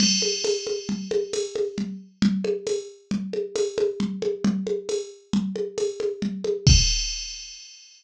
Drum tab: CC |x---------|----------|----------|x---------|
TB |--x---x---|--x---x---|--x---x---|----------|
CG |OoooOoooO-|Ooo-OoooOo|Ooo-OoooOo|----------|
BD |----------|----------|----------|o---------|